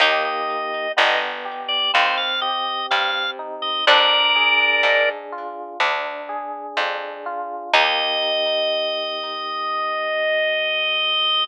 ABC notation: X:1
M:4/4
L:1/16
Q:1/4=62
K:Eb
V:1 name="Drawbar Organ"
e e3 e z2 d c f e2 f2 z e | [Bd]6 z10 | e16 |]
V:2 name="Harpsichord"
E16 | D8 z8 | E16 |]
V:3 name="Electric Piano 1"
[B,EG]4 =B,2 G2 C2 G2 C2 E2 | D2 A2 D2 F2 D2 A2 D2 F2 | [B,EG]16 |]
V:4 name="Harpsichord" clef=bass
E,,4 G,,,4 E,,4 G,,4 | F,,4 A,,4 D,,4 F,,4 | E,,16 |]